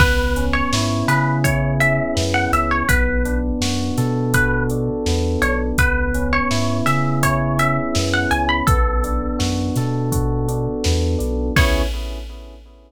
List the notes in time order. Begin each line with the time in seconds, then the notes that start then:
0.00 C#2 B3 B4, kick, crash
0.36 C#4, closed hi-hat
0.53 C#5
0.72 G#2 E4, snare
1.08 C#3 G#4 B4, snare, closed hi-hat
1.44 E4 C#5, kick, closed hi-hat
1.80 C#4 E5, closed hi-hat
2.15 F#2 B3, snare
2.34 F#5
2.52 C#2 C#4 E5, closed hi-hat
2.71 C#5
2.89 B1 B3 B4, kick, closed hi-hat
3.25 D4, closed hi-hat
3.61 F#2 F#4, snare
3.98 B2 A4, snare, closed hi-hat
4.33 F#4 B4, kick, closed hi-hat
4.70 D4, closed hi-hat
5.06 E2 B3, snare
5.42 B1 D4 C#5, closed hi-hat
5.78 C#2 B3 B4, kick, closed hi-hat
6.14 C#4, closed hi-hat
6.33 C#5
6.51 G#2 E4, snare
6.86 C#3 G#4 E5, snare, closed hi-hat
7.23 E4 C#5, kick, closed hi-hat
7.58 C#4 E5, closed hi-hat
7.95 F#2 B3, snare
8.14 F#5
8.31 C#2 C#4 G#5, closed hi-hat
8.49 B5
8.67 B1 B3 A4, kick, closed hi-hat
9.04 D4, closed hi-hat
9.39 F#2 F#4, snare
9.76 B2 A4, snare, closed hi-hat
10.12 F#4, kick, closed hi-hat
10.48 D4, closed hi-hat
10.84 E2 B3, snare
11.19 B1 D4, closed hi-hat
11.56 C#2 B3 C#4 E4 G#4 C#5, kick, crash